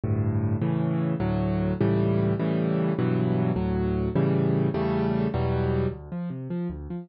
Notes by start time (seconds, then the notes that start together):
0.04 D2 G2 A2
0.62 A2 C#3 E3
1.20 D2 A2 F#3
1.81 C#2 A2 E3 G3
2.39 A2 C#3 E3 G3
2.99 G2 B2 E3 F#3
3.56 D2 A2 F#3
4.16 A2 C#3 E3 G3
4.74 E2 C#3 G3 A3
5.34 E2 B2 F#3 G3
5.91 D2
6.12 F3
6.30 C3
6.50 F3
6.70 D2
6.90 F3